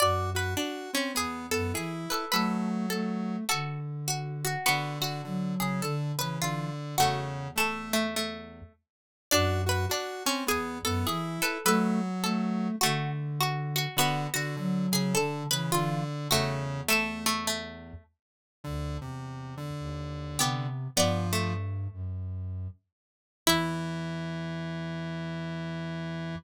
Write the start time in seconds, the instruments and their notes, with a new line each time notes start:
0.00 flute F#2, lead 1 (square) F#4, pizzicato strings D5, harpsichord D5
0.35 lead 1 (square) F#4, harpsichord B4
0.57 harpsichord D4, lead 1 (square) F#4
0.93 lead 1 (square) C4, harpsichord C#4
1.14 flute E2, lead 1 (square) B3, pizzicato strings G#4, harpsichord G#4
1.51 flute F#2, lead 1 (square) B3, harpsichord A4
1.74 flute E3, lead 1 (square) E4, pizzicato strings G#4
2.10 pizzicato strings A4, harpsichord B4
2.32 lead 1 (square) F#3, flute A3, pizzicato strings A4, harpsichord B4
2.90 flute A3, harpsichord A4
3.49 flute D3, pizzicato strings F#4, harpsichord A4
4.08 pizzicato strings F#4
4.45 pizzicato strings F#4
4.66 lead 1 (square) D3, harpsichord B3, pizzicato strings F#4
5.00 lead 1 (square) D3, pizzicato strings F#4
5.24 lead 1 (square) D3, flute F#3
5.60 lead 1 (square) C#3, pizzicato strings G#4
5.82 lead 1 (square) D3, flute D3, pizzicato strings A4
6.17 lead 1 (square) C#3, flute E3, pizzicato strings B4
6.42 lead 1 (square) D3, pizzicato strings F4
6.98 flute E2, lead 1 (square) C#3, harpsichord A3, pizzicato strings F#4
7.56 lead 1 (square) A3, harpsichord A3, pizzicato strings A4
7.93 harpsichord A3
8.16 harpsichord A3
9.31 flute F#2, harpsichord D4, lead 1 (square) F#4, pizzicato strings D5
9.66 lead 1 (square) F#4, harpsichord B4
9.89 harpsichord D4, lead 1 (square) F#4
10.26 lead 1 (square) C4, harpsichord C#4
10.46 flute E2, lead 1 (square) B3, harpsichord G#4, pizzicato strings G#5
10.85 flute F#2, lead 1 (square) B3, harpsichord A4
11.06 flute E3, lead 1 (square) E4, pizzicato strings G#4
11.42 pizzicato strings A4, harpsichord B4
11.65 lead 1 (square) F#3, flute A3, pizzicato strings A4, harpsichord B4
12.23 flute A3, harpsichord A4
12.81 flute D3, harpsichord A3, pizzicato strings F#4
13.41 pizzicato strings F#4
13.76 pizzicato strings F#4
13.96 lead 1 (square) D3, harpsichord B3, pizzicato strings F#4
14.34 lead 1 (square) D3, pizzicato strings F#4
14.56 lead 1 (square) D3, flute F#3
14.92 lead 1 (square) C#3, pizzicato strings G#4
15.14 lead 1 (square) D3, flute D3, pizzicato strings A4
15.51 lead 1 (square) C#3, flute E3, pizzicato strings B4
15.72 lead 1 (square) D3, pizzicato strings F4
16.30 flute E2, lead 1 (square) C#3, harpsichord A3, pizzicato strings F#4
16.88 harpsichord A3, lead 1 (square) A3, pizzicato strings A4
17.26 harpsichord A3
17.47 harpsichord A3
18.64 flute D2, lead 1 (square) D3
19.00 flute E2, lead 1 (square) C3
19.57 lead 1 (square) D3
19.80 flute D#2
20.38 flute C3, harpsichord B3, pizzicato strings G4
20.96 flute G2, lead 1 (square) F3, harpsichord B3, pizzicato strings D5
21.33 harpsichord A3
21.92 flute F#2
23.46 flute E2, lead 1 (square) E3, harpsichord E4, pizzicato strings E5